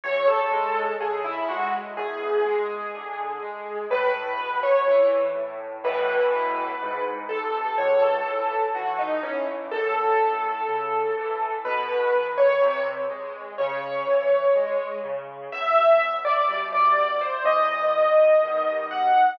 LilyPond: <<
  \new Staff \with { instrumentName = "Acoustic Grand Piano" } { \time 4/4 \key e \major \tempo 4 = 62 cis''16 a'8. gis'16 e'16 fis'16 r16 gis'2 | b'8. cis''8 r8. b'4. a'8 | cis''16 a'8. fis'16 dis'16 cis'16 r16 a'2 | b'8. cis''8 r8. cis''4. r8 |
\key e \minor e''8. d''8 d''8 c''16 dis''4. fis''8 | }
  \new Staff \with { instrumentName = "Acoustic Grand Piano" } { \clef bass \time 4/4 \key e \major e,8 gis8 cis8 gis8 e,8 gis8 d8 gis8 | a,8 b,8 e8 a,8 <a, b, e>4 gis,8 bis,8 | cis,8 e8 e8 e8 fis,8 a,8 cis8 e8 | b,8 dis8 bis,8 gis8 cis8 e8 gis8 cis8 |
\key e \minor e,4 <b, g>4 e,4 <b, dis g>4 | }
>>